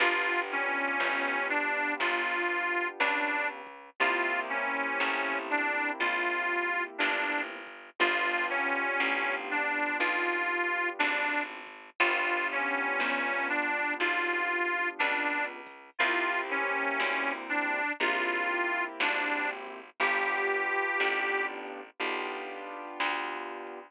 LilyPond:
<<
  \new Staff \with { instrumentName = "Harmonica" } { \time 4/4 \key g \major \tempo 4 = 60 f'8 cis'4 d'8 f'4 d'8 r8 | f'8 cis'4 d'8 f'4 d'8 r8 | f'8 cis'4 d'8 f'4 d'8 r8 | f'8 cis'4 d'8 f'4 d'8 r8 |
f'8 cis'4 d'8 f'4 d'8 r8 | g'4. r2 r8 | }
  \new Staff \with { instrumentName = "Acoustic Grand Piano" } { \time 4/4 \key g \major <b d' f' g'>1 | <bes c' e' g'>1 | <b d' f' g'>1 | <b d' f' g'>1 |
<bes c' e' g'>2 <bes c' e' g'>2 | <b d' f' g'>2 <b d' f' g'>2 | }
  \new Staff \with { instrumentName = "Electric Bass (finger)" } { \clef bass \time 4/4 \key g \major g,,4 g,,4 g,,4 cis,4 | c,4 a,,4 bes,,4 g,,4 | g,,4 a,,4 b,,4 gis,,4 | g,,4 g,,4 b,,4 cis,4 |
c,4 d,4 bes,,4 gis,,4 | g,,4 a,,4 b,,4 d,4 | }
  \new DrumStaff \with { instrumentName = "Drums" } \drummode { \time 4/4 \tuplet 3/2 { <cymc bd>8 r8 hh8 sn8 r8 hh8 <hh bd>8 r8 hh8 sn8 r8 <hh bd>8 } | \tuplet 3/2 { <hh bd>8 r8 hh8 sn8 r8 hh8 <hh bd>8 r8 hh8 sn8 bd8 <bd hh>8 } | \tuplet 3/2 { <hh bd>8 r8 hh8 sn8 r8 hh8 <hh bd>8 r8 hh8 sn8 r8 <hh bd>8 } | \tuplet 3/2 { <hh bd>8 r8 hh8 sn8 r8 hh8 <hh bd>8 r8 hh8 sn8 bd8 <hho bd>8 } |
\tuplet 3/2 { <hh bd>8 r8 hh8 sn8 r8 hh8 <hh bd>8 r8 hh8 sn8 r8 <hh bd>8 } | \tuplet 3/2 { <hh bd>8 r8 hh8 sn8 r8 hh8 <hh bd>8 r8 hh8 sn8 bd8 <hh bd>8 } | }
>>